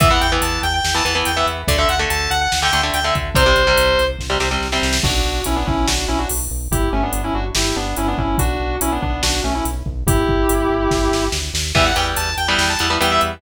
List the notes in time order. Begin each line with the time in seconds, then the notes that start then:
0.00 E2 E3 B3 E5, kick, closed hi-hat
0.11 E3 B3 F#5
0.21 E2 G5, closed hi-hat
0.32 E3 B3
0.42 E2 A5, closed hi-hat
0.63 E2 G5, closed hi-hat
0.74 G5
0.84 E2, snare
0.94 E3 B3 A5
1.05 E2 E3 B3, closed hi-hat
1.15 E3 B3
1.25 E2 G5, closed hi-hat
1.36 E3 B3 E5
1.46 E2, closed hi-hat
1.67 D2 D3 A3 D5, kick, closed hi-hat
1.78 D3 A3 E5
1.88 D2 F#5, closed hi-hat
1.99 D3 A3
2.10 D2 A5, closed hi-hat
2.30 D2 F#5, closed hi-hat
2.41 F#5
2.52 D2, snare
2.62 D3 A3 G5
2.73 D2 D3 A3, closed hi-hat
2.83 D3 A3
2.94 D2 G5, closed hi-hat
3.04 D3 A3 E5
3.15 D2, kick, closed hi-hat
3.35 C2 C3 G3 C5, kick, closed hi-hat
3.46 C3 G3
3.56 C2, closed hi-hat
3.67 C3 G3
3.77 C2, closed hi-hat
3.98 C2, closed hi-hat
4.19 C2, kick, snare
4.30 C3 G3
4.40 C2 C3 G3, snare
4.51 C3 G3
4.61 C2, snare
4.72 C3 G3, snare
4.82 C2, snare
4.93 snare
5.03 B1 D4 F#4, kick, crash
5.24 B1
5.44 B1 C#4 E4, closed hi-hat
5.56 B3 D4
5.66 B1 C#4 E4, kick
5.87 B1 D4 F#4, snare
6.08 B1 C#4 E4
6.18 D4 F#4
6.29 B1, open hi-hat
6.50 B1
6.71 G1 E4 G4, kick, closed hi-hat
6.92 G1 A3 C#4
7.03 B3 D4
7.13 G1, closed hi-hat
7.24 C#4 E4
7.34 G1 D4 F#4
7.55 G1 E4 G4, snare
7.76 G1 B3 D4
7.97 G1 C#4 E4, closed hi-hat
8.08 B3 D4
8.18 G1 C#4 E4, kick
8.38 B1 D4 F#4, kick, closed hi-hat
8.60 B1
8.80 B1 C#4 E4, closed hi-hat
8.92 B3 D4
9.02 B1 B3 D4, kick
9.23 B1 D4 F#4, snare
9.43 B1 A3 C#4
9.55 C#4 E4
9.65 B1, closed hi-hat
9.86 B1, kick
10.06 G1 E4 G4, kick, closed hi-hat
10.27 G1, kick
10.49 G1, closed hi-hat
10.69 G1
10.91 G1, kick, snare
11.11 G1, snare
11.32 D2, snare
11.54 D#2, snare
11.75 E2 E3 G3 B3 E5, kick, crash
11.85 F#5
11.96 E2 E3 G3 B3 G5, closed hi-hat
12.16 E2 A5, closed hi-hat
12.37 E2 G5, closed hi-hat
12.48 E3 G3 B3 G5
12.58 E2, snare
12.69 A5
12.79 E2 E3 G3 B3, closed hi-hat
12.90 E3 G3 B3
13.01 E2 E3 G3 B3 G5, closed hi-hat
13.11 E5
13.21 E2, closed hi-hat